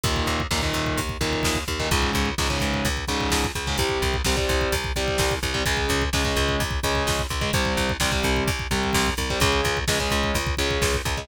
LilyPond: <<
  \new Staff \with { instrumentName = "Overdriven Guitar" } { \clef bass \time 4/4 \key c \phrygian \tempo 4 = 128 <bes, ees>4 <bes, ees>16 <bes, ees>4~ <bes, ees>16 <bes, ees>4~ <bes, ees>16 <bes, ees>16 | <aes, des>4 <aes, des>16 <aes, des>4~ <aes, des>16 <aes, des>4~ <aes, des>16 <aes, des>16 | <c g>4 <c g>16 <c g>4~ <c g>16 <c g>4~ <c g>16 <c g>16 | <des aes>4 <des aes>16 <des aes>4~ <des aes>16 <des aes>4~ <des aes>16 <des aes>16 |
<c g>4 <c g>16 <c g>4~ <c g>16 <c g>4~ <c g>16 <c g>16 | <des aes>4 <des aes>16 <des aes>4~ <des aes>16 <des aes>4~ <des aes>16 <des aes>16 | }
  \new Staff \with { instrumentName = "Electric Bass (finger)" } { \clef bass \time 4/4 \key c \phrygian ees,8 ees,8 ees,8 ees,8 ees,8 ees,8 ees,8 ees,8 | des,8 des,8 des,8 des,8 des,8 des,8 des,8 des,8 | c,8 c,8 c,8 c,8 c,8 c,8 c,8 c,8 | des,8 des,8 des,8 des,8 des,8 des,8 des,8 des,8 |
c,8 c,8 c,8 c,8 c,8 c,8 c,8 c,8 | des,8 des,8 des,8 des,8 des,8 des,8 des,8 des,8 | }
  \new DrumStaff \with { instrumentName = "Drums" } \drummode { \time 4/4 <hh bd>16 bd16 <hh bd>16 bd16 <bd sn>16 bd16 <hh bd>16 bd16 <hh bd>16 bd16 <hh bd>16 bd16 <bd sn>16 bd16 <hh bd>16 bd16 | <hh bd>16 bd16 <hh bd>16 bd16 <bd sn>16 bd16 <hh bd>16 bd16 <hh bd>16 bd16 <hh bd>16 bd16 <bd sn>16 bd16 <hh bd>16 bd16 | <hh bd>16 bd16 <hh bd>16 bd16 <bd sn>16 bd16 <hh bd>16 bd16 <hh bd>16 bd16 <hh bd>16 bd16 <bd sn>16 bd16 <hh bd>16 bd16 | <hh bd>16 bd16 <hh bd>16 bd16 <bd sn>16 bd16 <hh bd>16 bd16 <hh bd>16 bd16 <hh bd>16 bd16 <bd sn>16 bd16 <hh bd>16 bd16 |
<hh bd>16 bd16 <hh bd>16 bd16 <bd sn>16 bd16 <hh bd>16 bd16 <hh bd>16 bd16 <hh bd>16 bd16 <bd sn>16 bd16 <hh bd>16 bd16 | <hh bd>16 bd16 <hh bd>16 bd16 <bd sn>16 bd16 <hh bd>16 bd16 <hh bd>16 bd16 <hh bd>16 bd16 <bd sn>16 bd16 <hh bd>16 bd16 | }
>>